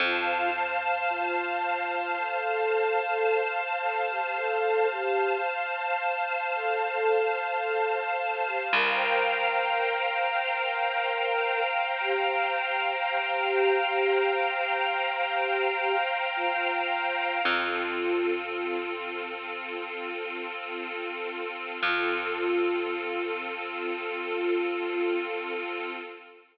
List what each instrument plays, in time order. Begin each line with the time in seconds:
0.00 electric bass (finger) F2, flute F4, pad 2 (warm) C5 F5 A5
1.10 flute F4
2.18 flute A4
3.81 flute A4
4.09 flute G4
4.36 flute A4
4.91 flute G4
6.54 flute A4
8.18 flute A4
8.45 flute G4
8.72 electric bass (finger) C2, flute A#4, pad 2 (warm) C5 F5 G5 A#5
12.01 flute G4
13.08 flute G4
16.36 flute F4
17.44 electric bass (finger) F2, pad 2 (warm) C4 F4 A4, flute F4
21.82 electric bass (finger) F2, pad 2 (warm) C4 F4 A4, flute F4